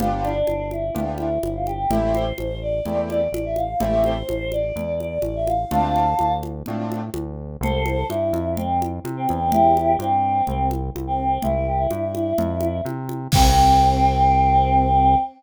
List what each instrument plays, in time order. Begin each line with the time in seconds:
0.00 synth bass 1 G1, acoustic grand piano B3 D4 F4 G4, choir aahs F4, low conga
0.24 choir aahs D4, high conga
0.47 synth bass 1 G1, high conga
0.71 choir aahs E4, high conga
0.95 synth bass 1 D2, acoustic grand piano B3 D4 F4 G4, low conga
1.18 choir aahs E4, high conga
1.43 synth bass 1 G1, choir aahs E4, high conga
1.55 choir aahs F4
1.67 choir aahs G4, high conga
1.90 synth bass 1 A1, acoustic grand piano A3 C4 E4 G4, choir aahs E5, low conga
2.14 choir aahs C5, high conga
2.38 synth bass 1 A1, high conga
2.62 choir aahs D5
2.86 synth bass 1 E2, acoustic grand piano A3 C4 E4 G4, low conga
3.10 choir aahs D5, high conga
3.32 synth bass 1 A1, choir aahs D5, high conga
3.45 choir aahs E5
3.56 choir aahs F5, high conga
3.80 synth bass 1 A1, acoustic grand piano A3 C4 E4 G4, choir aahs E5, low conga
4.04 choir aahs C5, high conga
4.29 synth bass 1 A1, high conga
4.52 choir aahs D5, high conga
4.76 synth bass 1 E2, low conga
5.00 choir aahs D5, high conga
5.22 synth bass 1 A1, choir aahs D5, high conga
5.36 choir aahs E5
5.47 choir aahs F5, high conga
5.71 synth bass 1 D2, acoustic grand piano A3 C4 D4 F4, choir aahs F5 A5, low conga
5.96 high conga
6.19 synth bass 1 D2, high conga
6.43 high conga
6.66 synth bass 1 A2, acoustic grand piano A3 C4 D4 F4, low conga
6.92 high conga
7.14 synth bass 1 D2, high conga
7.61 synth bass 1 C2, choir aahs A4 C5, low conga
7.86 high conga
8.09 synth bass 1 G2, choir aahs E4, high conga
8.33 synth bass 1 F2, high conga
8.57 choir aahs C4, low conga
8.82 high conga
9.04 synth bass 1 C3, high conga
9.17 choir aahs C4
9.29 synth bass 1 E2, high conga
9.52 choir aahs E4 G4, low conga
9.77 high conga
9.99 synth bass 1 G2, choir aahs C4, high conga
10.47 synth bass 1 C2, choir aahs C4, low conga
10.71 high conga
10.95 synth bass 1 C2, high conga
11.07 choir aahs C4
11.42 synth bass 1 C2, choir aahs E4, low conga
11.55 choir aahs E4
11.67 choir aahs G4
11.79 choir aahs E4
11.91 synth bass 1 G2, high conga
12.15 high conga
12.38 synth bass 1 F2, low conga
12.61 high conga
12.85 synth bass 1 C3, high conga
13.09 high conga
13.32 synth bass 1 C2, choir aahs C4, kick, crash